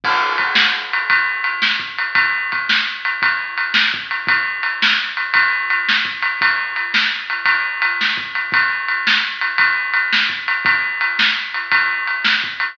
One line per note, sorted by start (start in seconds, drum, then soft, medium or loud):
0.04 kick medium
0.04 crash medium
0.38 kick medium
0.38 ride medium
0.55 snare loud
0.93 ride medium
1.10 kick medium
1.10 ride medium
1.44 ride medium
1.62 snare medium
1.80 kick medium
1.98 ride medium
2.15 kick medium
2.15 ride medium
2.52 kick medium
2.52 ride medium
2.69 snare medium
3.05 ride medium
3.22 kick medium
3.22 ride medium
3.58 ride medium
3.74 snare loud
3.94 kick medium
4.11 ride medium
4.27 kick medium
4.27 ride medium
4.63 ride medium
4.82 snare loud
5.17 ride medium
5.34 kick medium
5.34 ride medium
5.70 ride medium
5.89 snare medium
6.05 kick medium
6.22 ride medium
6.41 kick medium
6.41 ride medium
6.76 ride medium
6.94 snare medium
7.30 ride medium
7.46 kick medium
7.46 ride medium
7.82 ride medium
8.01 snare medium
8.17 kick medium
8.35 ride medium
8.52 kick loud
8.52 ride medium
8.88 ride medium
9.07 snare medium
9.41 ride medium
9.58 kick medium
9.58 ride medium
9.94 ride medium
10.13 snare medium
10.30 kick medium
10.48 ride medium
10.65 kick loud
10.65 ride medium
11.01 ride medium
11.19 snare medium
11.54 ride medium
11.72 kick medium
11.72 ride medium
12.08 ride medium
12.25 snare medium
12.44 kick medium
12.60 ride medium